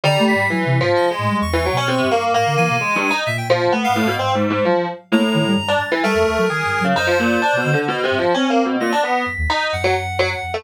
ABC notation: X:1
M:2/4
L:1/16
Q:1/4=130
K:none
V:1 name="Electric Piano 2"
G,4 | (3E,4 F,4 _A,4 | z E, _G, _D C,2 _B,2 | _B,4 (3_A,2 G,,2 _E2 |
z2 F,2 B,2 A,, B,, | (3C2 _A,,2 A,,2 F,2 z2 | A,,4 z D z E, | A,4 _A3 _D, |
_E F, _B,,2 (3D2 =B,,2 D,2 | (3B,,2 C,2 F,2 (3_D2 _B,2 =B,,2 | _B,, D =B,2 z2 _E2 | z _G, z2 G, z2 A, |]
V:2 name="Clarinet"
_b2 =b'2 | b'4 _e4 | _d'8 | _b'2 _a6 |
e g z3 f3 | z8 | _b6 a'2 | _B8 |
c8 | _e6 z2 | _b'2 =b'6 | _g8 |]
V:3 name="Ocarina"
(3D,2 A,2 _A,,2 | (3_G,2 C,2 _A,,2 z2 =A,, =G, | (3E,,4 B,,4 G,,4 | A,, D, E, B,, z4 |
_B,,4 (3A,2 _A,,2 A,,2 | _A,,4 _G, z3 | _B, z _E, G, G,,2 z2 | G, F,, _E,, _G, (3_E,2 =G,,2 _G,2 |
_G,,4 z B,, D, z | z2 G,, z C4 | z4 _G,, _E,, z2 | _G,,6 F,,2 |]